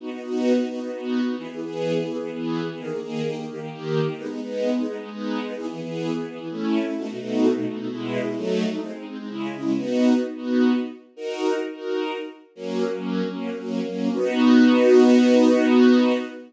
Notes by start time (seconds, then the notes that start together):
0.00 B3 D#4 F#4
0.11 B3 D#4 F#4
0.24 B3 D#4 F#4
0.58 B3 D#4 F#4
0.70 B3 D#4 F#4
0.81 B3 D#4 F#4
0.93 B3 D#4 F#4
1.26 B3 D#4 F#4
1.38 E3 B3 G#4
1.51 E3 B3 G#4
1.65 E3 B3 G#4
1.97 E3 B3 G#4
2.07 E3 B3 G#4
2.21 E3 B3 G#4
2.33 E3 B3 G#4
2.69 E3 B3 G#4
2.79 D#3 A#3 G#4
2.91 D#3 A#3 G#4
3.03 D#3 A#3 G#4
3.26 D#3 A#3 G4
3.36 D#3 A#3 G4
3.50 D#3 A#3 G4
3.60 D#3 A#3 G4
3.72 D#3 A#3 G4
4.05 D#3 A#3 G4
4.18 G#3 B3 D#4
4.30 G#3 B3 D#4
4.42 G#3 B3 D#4
4.77 G#3 B3 D#4
4.87 G#3 B3 D#4
5.00 G#3 B3 D#4
5.12 G#3 B3 D#4
5.45 G#3 B3 D#4
5.57 E3 B3 G#4
5.71 E3 B3 G#4
5.83 E3 B3 G#4
6.17 E3 B3 G#4
6.29 E3 B3 G#4
6.39 E3 B3 G#4
6.51 A3 C#4 E4
6.84 A3 C#4 E4
6.98 B2 A3 D#4 F#4
7.10 B2 A3 D#4 F#4
7.19 B2 A3 D#4 F#4
7.56 B2 A3 D#4 F#4
7.69 B2 A3 D#4 F#4
7.78 B2 A3 D#4 F#4
7.90 B2 G#3 E4
8.25 B2 G#3 E4
8.36 F#3 A3 D#4
8.70 F#3 A3 D#4
8.82 G#3 C4 D#4
8.96 G#3 C4 D#4
9.08 G#3 C4 D#4
9.19 G#3 C4 D#4
9.29 C#3 G#3 E4
9.53 C#3 G#3 E4
9.76 B3 D#4 F#4
10.35 B3 D#4 F#4
11.16 D#4 F#4 A#4
11.74 D#4 F#4 A#4
12.55 F#3 A#3 C#4
12.92 F#3 A#3 C#4
13.28 F#3 A#3 C#4
13.58 F#3 A#3 C#4
13.85 F#3 A#3 C#4
14.14 B3 D#4 F#4